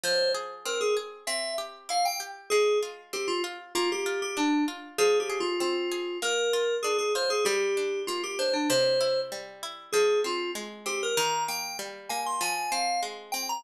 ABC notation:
X:1
M:2/4
L:1/16
Q:1/4=97
K:Fdor
V:1 name="Electric Piano 2"
c2 z2 B A z2 | =e2 z2 f g z2 | A2 z2 G F z2 | F G2 G D2 z2 |
(3A2 G2 F2 F4 | B4 A A c A | G4 F G c D | c4 z4 |
A2 F2 z2 G B | b2 g2 z2 a c' | a2 f2 z2 g b |]
V:2 name="Harpsichord"
F,2 A2 C2 A2 | C2 G2 =E2 G2 | A,2 F2 C2 F2 | B,2 F2 D2 F2 |
F,2 A2 C2 A2 | B,2 F2 D2 F2 | G,2 D2 B,2 D2 | C,2 =E2 G,2 E2 |
F,2 C2 A,2 C2 | E,2 B,2 G,2 B,2 | F,2 C2 A,2 C2 |]